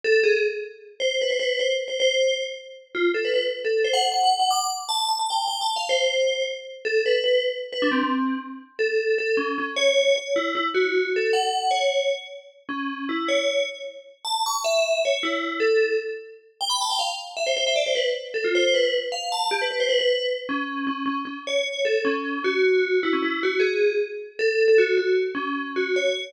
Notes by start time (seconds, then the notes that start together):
0.04 A4
0.23 G#4
1.00 C5
1.22 B4
1.31 C5
1.40 B4
1.59 C5
1.88 C5
2.00 C5
2.95 F4
3.14 A4
3.25 B4
3.34 B4
3.65 A4
3.84 C5
3.93 F#5
4.12 F#5
4.23 F#5
4.40 F#5
4.51 D6
4.89 A5
5.09 A5
5.19 A5
5.30 G5
5.48 G5
5.61 A5
5.76 F5
5.89 C5
6.85 A4
7.06 B4
7.24 B4
7.72 B4
7.82 D4
7.91 C4
8.02 C4
8.79 A4
9.18 A4
9.37 C#4
9.58 C#4
9.76 C#5
10.16 C#5
10.36 E4
10.55 E4
10.74 F#4
11.16 A4
11.33 F#5
11.71 C#5
12.69 C#4
13.09 E4
13.28 C#5
14.25 A5
14.46 C#6
14.64 E5
15.05 C#5
15.23 E4
15.60 A4
16.61 G5
16.70 B5
16.81 A5
16.90 G5
16.99 F5
17.37 E5
17.47 C5
17.57 C5
17.67 E5
17.76 D5
17.86 C5
17.95 B4
18.34 A4
18.44 F4
18.55 C5
18.74 B4
19.12 F5
19.32 A5
19.51 G4
19.62 B4
19.71 B4
19.80 C5
19.89 B4
19.99 B4
20.49 C#4
20.87 C#4
21.06 C#4
21.25 C#4
21.47 C#5
21.85 A4
22.05 C#4
22.44 F#4
23.03 E4
23.13 C#4
23.22 E4
23.43 F#4
23.60 G#4
24.39 A4
24.68 A4
24.78 F#4
24.98 F#4
25.35 C#4
25.76 F#4
25.96 C#5